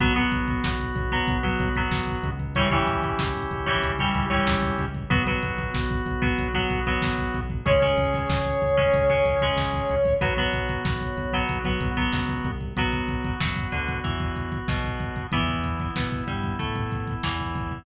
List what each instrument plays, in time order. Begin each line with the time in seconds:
0.00 synth bass 1 B1, acoustic guitar (steel) F#3 B3, drawbar organ B3 F#4, kick, closed hi-hat
0.16 acoustic guitar (steel) F#3 B3, kick
0.32 synth bass 1 B1, kick, closed hi-hat
0.48 kick
0.64 synth bass 1 B1, kick, snare
0.80 kick
0.95 synth bass 1 B1, kick, closed hi-hat
1.12 acoustic guitar (steel) F#3 B3, kick
1.28 synth bass 1 B1, kick, closed hi-hat
1.43 acoustic guitar (steel) F#3 B3, kick
1.59 synth bass 1 B1, kick, closed hi-hat
1.76 acoustic guitar (steel) F#3 B3, kick
1.91 synth bass 1 B1, kick, snare
2.08 kick
2.23 synth bass 1 C#2, kick, closed hi-hat
2.39 kick
2.55 acoustic guitar (steel) E3 G3 C#4, drawbar organ C#4 E4 G4, kick, closed hi-hat
2.71 acoustic guitar (steel) E3 G3 C#4, kick
2.87 synth bass 1 C#2, kick, closed hi-hat
3.03 kick
3.19 synth bass 1 C#2, kick, snare
3.35 kick
3.51 synth bass 1 C#2, kick, closed hi-hat
3.66 acoustic guitar (steel) E3 G3 C#4, kick
3.83 synth bass 1 C#2, kick, closed hi-hat
3.99 acoustic guitar (steel) E3 G3 C#4, kick
4.15 synth bass 1 C#2, kick, closed hi-hat
4.30 acoustic guitar (steel) E3 G3 C#4, kick
4.47 synth bass 1 C#2, kick, snare
4.63 kick
4.78 synth bass 1 C#2, kick, closed hi-hat
4.95 kick
5.10 synth bass 1 B1, acoustic guitar (steel) F#3 B3, drawbar organ B3 F#4, kick, closed hi-hat
5.27 acoustic guitar (steel) F#3 B3, kick
5.42 synth bass 1 B1, kick, closed hi-hat
5.59 kick
5.74 synth bass 1 B1, kick, snare
5.91 kick
6.06 synth bass 1 B1, kick, closed hi-hat
6.22 acoustic guitar (steel) F#3 B3, kick
6.38 synth bass 1 B1, kick, closed hi-hat
6.54 acoustic guitar (steel) F#3 B3, kick
6.70 synth bass 1 B1, kick, closed hi-hat
6.86 acoustic guitar (steel) F#3 B3, kick
7.02 synth bass 1 B1, kick, snare
7.18 kick
7.34 synth bass 1 B1, kick, open hi-hat
7.50 kick
7.65 synth bass 1 C#2, acoustic guitar (steel) G#3 C#4, drawbar organ C#4 G#4, brass section C#5, kick, closed hi-hat
7.82 acoustic guitar (steel) G#3 C#4, kick
7.97 synth bass 1 C#2, kick, closed hi-hat
8.14 kick
8.29 synth bass 1 C#2, kick, snare
8.46 kick
8.62 synth bass 1 C#2, kick, closed hi-hat
8.77 acoustic guitar (steel) G#3 C#4, kick
8.94 synth bass 1 C#2, kick, closed hi-hat
9.10 acoustic guitar (steel) G#3 C#4, kick
9.25 synth bass 1 C#2, kick, closed hi-hat
9.41 acoustic guitar (steel) G#3 C#4, kick
9.57 synth bass 1 C#2, kick, snare
9.73 kick
9.89 synth bass 1 C#2, kick, closed hi-hat
10.05 kick
10.21 synth bass 1 B1, acoustic guitar (steel) F#3 B3, drawbar organ B3 F#4, kick, closed hi-hat
10.37 acoustic guitar (steel) F#3 B3, kick
10.53 synth bass 1 B1, kick, closed hi-hat
10.69 kick
10.85 synth bass 1 B1, kick, snare
11.01 kick
11.17 synth bass 1 B1, kick, closed hi-hat
11.33 acoustic guitar (steel) F#3 B3, kick
11.49 synth bass 1 B1, kick, closed hi-hat
11.65 acoustic guitar (steel) F#3 B3, kick
11.81 synth bass 1 B1, kick, closed hi-hat
11.97 acoustic guitar (steel) F#3 B3, kick
12.13 synth bass 1 C#2, kick, snare
12.29 kick
12.45 synth bass 1 C2, kick, closed hi-hat
12.61 kick
12.77 synth bass 1 B1, acoustic guitar (steel) F#3 B3, drawbar organ B3 F#4, kick, closed hi-hat
12.93 kick
13.08 kick, closed hi-hat
13.24 kick
13.40 synth bass 1 F#2, acoustic guitar (steel) F#3, kick, snare
13.56 kick
13.72 synth bass 1 D2, acoustic guitar (steel) D3, kick, closed hi-hat
13.88 kick
14.04 synth bass 1 E2, acoustic guitar (steel) E3, kick, closed hi-hat
14.20 kick
14.36 kick, closed hi-hat
14.52 kick
14.68 synth bass 1 B1, acoustic guitar (steel) B2, kick, snare
14.84 kick
15.00 kick, closed hi-hat
15.16 kick
15.32 synth bass 1 E2, acoustic guitar (steel) E3 B3, drawbar organ B3 E4, kick, closed hi-hat
15.48 kick
15.64 kick, closed hi-hat
15.80 kick
15.96 synth bass 1 B2, acoustic guitar (steel) B3, kick, snare
16.12 kick
16.27 synth bass 1 G2, acoustic guitar (steel) G3, kick, closed hi-hat
16.43 kick
16.59 synth bass 1 A2, acoustic guitar (steel) A3, kick, closed hi-hat
16.76 kick
16.92 kick, closed hi-hat
17.07 kick
17.23 synth bass 1 E2, acoustic guitar (steel) E3, kick, snare
17.40 kick
17.55 kick, closed hi-hat
17.71 kick